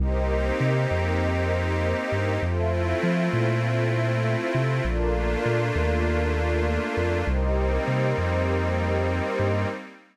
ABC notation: X:1
M:4/4
L:1/8
Q:1/4=99
K:Cdor
V:1 name="Pad 5 (bowed)"
[B,CEG]8 | [A,C=EF]8 | [A,B,DF]8 | [G,B,CE]8 |]
V:2 name="Pad 2 (warm)"
[GBce]8 | [FAc=e]8 | [FABd]8 | [GBce]8 |]
V:3 name="Synth Bass 2" clef=bass
C,,2 C, F,,4 G,, | F,,2 F, B,,4 C, | B,,,2 B,, E,,4 F,, | C,,2 C, F,,4 G,, |]